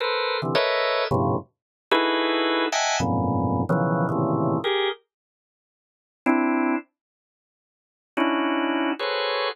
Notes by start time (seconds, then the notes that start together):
0.00 A4 A#4 B4 C5
0.42 C3 D3 E3
0.55 A4 A#4 B4 C#5 D#5 E5
1.11 F2 G2 A2 B2 C3 C#3
1.91 D#4 E4 F#4 G#4 A4 B4
2.72 D#5 E5 F#5 G5 G#5 A5
3.00 F2 F#2 G#2 A#2 B2
3.69 B2 C#3 D#3 E3 F3 F#3
4.09 A2 A#2 C3 C#3 D#3 E3
4.64 G4 G#4 A#4
6.26 C4 D4 E4
8.17 C#4 D4 D#4 E4 F#4
8.99 F#4 G#4 A4 B4 C5 C#5